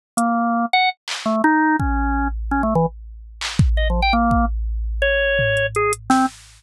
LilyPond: <<
  \new Staff \with { instrumentName = "Drawbar Organ" } { \time 7/8 \tempo 4 = 167 r8 bes4. ges''8 r4 | a8 ees'4 des'4. r8 | \tuplet 3/2 { des'8 a8 e8 } r2 r8 | \tuplet 3/2 { ees''8 f8 g''8 } bes4 r4. |
des''2 aes'8 r8 c'8 | }
  \new DrumStaff \with { instrumentName = "Drums" } \drummode { \time 7/8 r8 hh8 r4 r4 hc8 | r4 r8 bd8 r4. | r4 r4 r8 hc8 bd8 | r4 r8 bd8 r4. |
r4 tomfh8 hh8 hh8 hh8 sn8 | }
>>